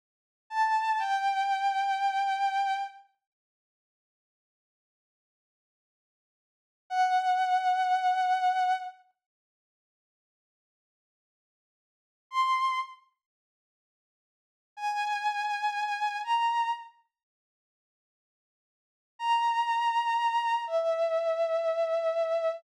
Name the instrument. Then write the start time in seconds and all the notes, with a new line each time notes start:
violin
0.50 A5
0.99 G5
6.90 F#5
12.31 C6
14.77 G#5
16.24 A#5
19.19 A#5
20.67 E5